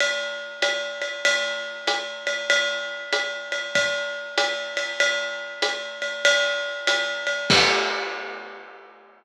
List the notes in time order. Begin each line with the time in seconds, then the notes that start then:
0.00 ride
0.62 hi-hat pedal, ride
1.02 ride
1.25 ride
1.87 hi-hat pedal, ride
2.27 ride
2.50 ride
3.13 hi-hat pedal, ride
3.52 ride
3.75 kick, ride
4.38 hi-hat pedal, ride
4.77 ride
5.00 ride
5.62 hi-hat pedal, ride
6.02 ride
6.25 ride
6.87 hi-hat pedal, ride
7.27 ride
7.50 kick, crash